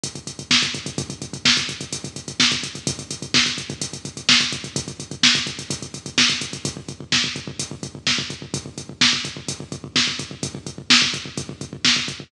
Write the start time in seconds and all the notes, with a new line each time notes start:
0.03 kick, closed hi-hat
0.15 kick, closed hi-hat
0.27 kick, closed hi-hat
0.39 kick, closed hi-hat
0.51 kick, snare
0.63 kick, closed hi-hat
0.74 kick, closed hi-hat
0.86 kick, closed hi-hat
0.98 kick, closed hi-hat
1.10 kick, closed hi-hat
1.22 kick, closed hi-hat
1.33 kick, closed hi-hat
1.45 kick, snare
1.57 kick, closed hi-hat
1.69 kick, closed hi-hat
1.81 kick, closed hi-hat
1.93 kick, closed hi-hat
2.04 kick, closed hi-hat
2.16 kick, closed hi-hat
2.28 kick, closed hi-hat
2.40 kick, snare
2.51 kick, closed hi-hat
2.63 kick, closed hi-hat
2.75 kick, closed hi-hat
2.87 kick, closed hi-hat
2.99 kick, closed hi-hat
3.11 kick, closed hi-hat
3.22 kick, closed hi-hat
3.34 kick, snare
3.46 kick, closed hi-hat
3.58 kick, closed hi-hat
3.70 kick, closed hi-hat
3.81 kick, closed hi-hat
3.93 kick, closed hi-hat
4.05 kick, closed hi-hat
4.17 kick, closed hi-hat
4.29 kick, snare
4.41 kick, closed hi-hat
4.52 kick, closed hi-hat
4.64 kick, closed hi-hat
4.76 kick, closed hi-hat
4.88 kick, closed hi-hat
5.00 kick, closed hi-hat
5.11 kick, closed hi-hat
5.23 kick, snare
5.35 kick, closed hi-hat
5.47 kick, closed hi-hat
5.59 kick, closed hi-hat
5.70 kick, closed hi-hat
5.82 kick, closed hi-hat
5.94 kick, closed hi-hat
6.06 kick, closed hi-hat
6.18 kick, snare
6.30 kick, closed hi-hat
6.41 kick, closed hi-hat
6.53 kick, closed hi-hat
6.65 kick, closed hi-hat
6.77 kick
6.88 kick, closed hi-hat
7.00 kick
7.12 kick, snare
7.24 kick
7.36 kick, closed hi-hat
7.47 kick
7.59 kick, closed hi-hat
7.71 kick
7.83 kick, closed hi-hat
7.95 kick
8.07 kick, snare
8.18 kick
8.30 kick, closed hi-hat
8.42 kick
8.54 kick, closed hi-hat
8.66 kick
8.78 kick, closed hi-hat
8.89 kick
9.01 kick, snare
9.13 kick
9.25 kick, closed hi-hat
9.37 kick
9.48 kick, closed hi-hat
9.60 kick
9.72 kick, closed hi-hat
9.84 kick
9.96 kick, snare
10.07 kick
10.19 kick, closed hi-hat
10.31 kick
10.43 kick, closed hi-hat
10.55 kick
10.67 kick, closed hi-hat
10.78 kick
10.90 kick, snare
11.02 kick
11.14 kick, closed hi-hat
11.25 kick
11.37 kick, closed hi-hat
11.49 kick
11.61 kick, closed hi-hat
11.73 kick
11.85 kick, snare
11.96 kick
12.08 kick, closed hi-hat
12.20 kick